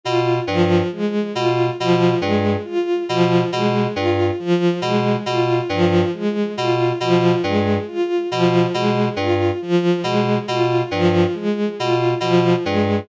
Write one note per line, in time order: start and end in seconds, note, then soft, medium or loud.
0.03 0.40 B2 medium
0.03 0.38 F4 medium
0.47 0.82 G2 medium
0.47 0.83 F3 medium
0.92 1.27 G#3 medium
1.34 1.70 B2 medium
1.34 1.69 F4 medium
1.79 2.15 B2 medium
1.79 2.14 F3 medium
2.20 2.56 G2 medium
2.20 2.55 G#3 medium
2.65 3.00 F4 medium
3.09 3.44 B2 medium
3.09 3.43 F3 medium
3.52 3.87 B2 medium
3.52 3.88 G#3 medium
3.96 4.31 G2 medium
3.96 4.30 F4 medium
4.39 4.74 F3 medium
4.82 5.16 B2 medium
4.82 5.17 G#3 medium
5.26 5.61 B2 medium
5.26 5.62 F4 medium
5.69 6.04 G2 medium
5.69 6.05 F3 medium
6.14 6.48 G#3 medium
6.57 6.92 B2 medium
6.57 6.93 F4 medium
7.00 7.35 B2 medium
7.00 7.36 F3 medium
7.43 7.78 G2 medium
7.43 7.78 G#3 medium
7.87 8.22 F4 medium
8.31 8.66 B2 medium
8.31 8.66 F3 medium
8.74 9.09 B2 medium
8.74 9.08 G#3 medium
9.16 9.51 G2 medium
9.16 9.53 F4 medium
9.62 9.97 F3 medium
10.04 10.38 B2 medium
10.04 10.39 G#3 medium
10.48 10.83 B2 medium
10.48 10.83 F4 medium
10.91 11.26 G2 medium
10.91 11.26 F3 medium
11.34 11.69 G#3 medium
11.79 12.14 B2 medium
11.79 12.13 F4 medium
12.20 12.55 B2 medium
12.20 12.55 F3 medium
12.64 13.00 G2 medium
12.64 12.99 G#3 medium